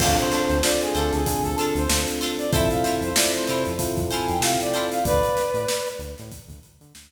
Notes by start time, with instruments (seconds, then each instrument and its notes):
0.00 synth bass 1 D2, electric piano 1 C4 D4 F4 A4, pizzicato strings D4 F4 A4 C5, brass section F5, kick, crash
0.18 brass section C5, closed hi-hat
0.32 pizzicato strings D4 F4 A4 C5, snare, closed hi-hat
0.50 synth bass 1 D2, closed hi-hat
0.63 electric piano 1 C4 D4 F4 A4, brass section D5, snare
0.81 brass section G#4, closed hi-hat
0.95 synth bass 1 D2, pizzicato strings D4 F4 A4 C5, brass section A4, closed hi-hat
1.13 synth bass 1 D2, brass section G#4, snare, closed hi-hat
1.26 electric piano 1 C4 D4 F4 A4, kick, closed hi-hat
1.43 synth bass 1 D2, brass section A4, closed hi-hat
1.57 pizzicato strings D4 F4 A4 C5, brass section A4, closed hi-hat
1.75 synth bass 1 D2, brass section C5, closed hi-hat
1.89 synth bass 1 D2, electric piano 1 C4 D4 F4 A4, snare
2.08 closed hi-hat
2.21 pizzicato strings D4 F4 A4 C5, snare, closed hi-hat
2.38 brass section D5, closed hi-hat
2.52 synth bass 1 F2, electric piano 1 C4 E4 F4 A4, pizzicato strings E4 F4 A4 C5, brass section E5, kick, closed hi-hat
2.70 brass section F5, closed hi-hat
2.84 pizzicato strings E4 F4 A4 C5, snare, closed hi-hat
3.01 synth bass 1 F2, brass section C5, closed hi-hat
3.15 electric piano 1 C4 E4 F4 A4, brass section D5, snare
3.34 brass section C5, closed hi-hat
3.46 synth bass 1 C3, pizzicato strings F4 A4 C5, brass section C5, closed hi-hat
3.50 pizzicato strings E4
3.65 synth bass 1 F2, closed hi-hat
3.79 electric piano 1 C4 E4 F4 A4, kick, closed hi-hat
3.97 synth bass 1 F2, kick, closed hi-hat
4.11 pizzicato strings E4 F4 A4 C5, brass section G#5, closed hi-hat
4.28 synth bass 1 F2, brass section G5, closed hi-hat
4.40 synth bass 1 C3, electric piano 1 C4 E4 F4 A4, brass section F5, snare
4.60 brass section D5, closed hi-hat
4.74 pizzicato strings E4 F4 A4 C5, closed hi-hat
4.91 brass section F5, snare, closed hi-hat
5.05 synth bass 1 D2, brass section B4 D5, kick, closed hi-hat
5.23 closed hi-hat
5.37 snare, closed hi-hat
5.54 synth bass 1 A2, closed hi-hat
5.68 snare
5.86 closed hi-hat
5.99 synth bass 1 D2, closed hi-hat
6.18 synth bass 1 A2, snare, closed hi-hat
6.32 kick, closed hi-hat
6.47 synth bass 1 D2, kick, closed hi-hat
6.63 closed hi-hat
6.81 synth bass 1 D3, closed hi-hat
6.95 synth bass 1 D2, snare